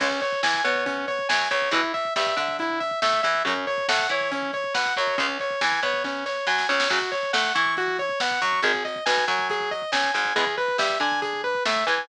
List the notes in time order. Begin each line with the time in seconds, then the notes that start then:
0.00 C#2 C#3 G#3 C#4, kick, crash
0.11 kick
0.22 C#5, kick, closed hi-hat
0.32 kick
0.43 E2 E3 G#5, kick, snare
0.54 kick
0.64 B2 B3 C#5, kick, closed hi-hat
0.75 kick
0.86 C#4, kick, closed hi-hat
0.97 kick
1.08 C#5, kick, closed hi-hat
1.19 kick
1.29 F#2 F#3 G#5, kick, snare
1.40 kick
1.51 C#2 C#3 C#5, kick, closed hi-hat
1.62 kick
1.71 E2 B2 E3 E4, kick, closed hi-hat
1.83 kick
1.94 E5, kick, closed hi-hat
2.05 kick
2.16 G2 G3 E5, kick, snare
2.27 kick
2.37 D3 D4 E5, kick, closed hi-hat
2.48 kick
2.59 E4, kick, closed hi-hat
2.70 kick
2.80 E5, kick, closed hi-hat
2.91 kick
3.02 A2 A3 E5, kick, snare
3.13 kick
3.23 E2 E3 E5, kick, closed hi-hat
3.35 kick
3.45 F#2 C#3 F#3 C#4, kick, closed hi-hat
3.56 kick
3.67 C#5, kick, closed hi-hat
3.78 kick
3.88 A2 A3 F#5, kick, snare
3.99 kick
4.09 E3 E4 C#5, kick, closed hi-hat
4.21 kick
4.31 C#4, kick, closed hi-hat
4.43 kick
4.53 C#5, kick, closed hi-hat
4.64 kick
4.74 B2 B3 F#5, kick, snare
4.86 kick
4.96 F#2 F#3 C#5, kick, closed hi-hat
5.07 kick
5.18 C#2 C#3 G#3 C#4, kick, closed hi-hat
5.29 kick
5.40 C#5, kick, closed hi-hat
5.50 kick
5.61 E2 E3 G#5, kick, snare
5.72 kick
5.83 B2 B3 C#5, kick, closed hi-hat
5.94 kick
6.04 C#4, kick, snare
6.26 C#5, snare
6.47 F#2 F#3 G#5, snare
6.58 snare
6.69 C#2 C#3 C#5, snare
6.80 snare
6.89 F#2 C#3 F#3 F#4, kick, crash
7.02 kick
7.12 C#5, kick, closed hi-hat
7.23 kick
7.33 A2 A3 F#5, kick, snare
7.45 kick
7.55 E3 E4 C#6, kick, closed hi-hat
7.66 kick
7.77 F#4, kick, closed hi-hat
7.88 kick
7.99 C#5, kick, closed hi-hat
8.09 kick
8.20 B2 B3 F#5, kick, snare
8.31 kick
8.42 F#2 F#3 C#6, kick, closed hi-hat
8.53 kick
8.62 G#1 D#3 G#3 G#4, kick, closed hi-hat
8.74 kick
8.85 D#5, kick, closed hi-hat
8.96 kick
9.06 B1 B2 G#5, kick, snare
9.17 kick
9.28 F#2 F#3 G#5, kick, closed hi-hat
9.39 kick
9.50 G#4, kick, closed hi-hat
9.60 kick
9.71 D#5, kick, closed hi-hat
9.82 kick
9.92 C#2 C#3 G#5, kick, snare
10.04 kick
10.14 G#1 G#2 G#5, kick, closed hi-hat
10.25 kick
10.36 E2 E3 G#3 B3 G#4, kick, closed hi-hat
10.47 kick
10.57 B4, kick, closed hi-hat
10.68 kick
10.78 G2 G3 E5, kick, snare
10.90 kick
11.00 D3 D4 G#5, kick, closed hi-hat
11.12 kick
11.22 G#4, kick, closed hi-hat
11.33 kick
11.44 B4, kick, closed hi-hat
11.55 kick
11.65 A2 A3 E5, kick, snare
11.76 kick
11.87 E2 E3 G#5, kick, closed hi-hat
11.98 kick